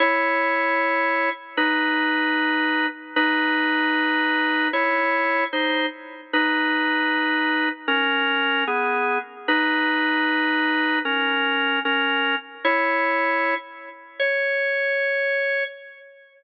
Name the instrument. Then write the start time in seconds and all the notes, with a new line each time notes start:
drawbar organ
0.00 E4 C#5
1.57 D#4 B4
3.16 D#4 B4
4.73 E4 C#5
5.53 D#4 C5
6.33 D#4 B4
7.88 C#4 A#4
8.67 B3 G#4
9.48 D#4 B4
11.05 C#4 A#4
11.85 C#4 A#4
12.65 E4 C#5
14.19 C#5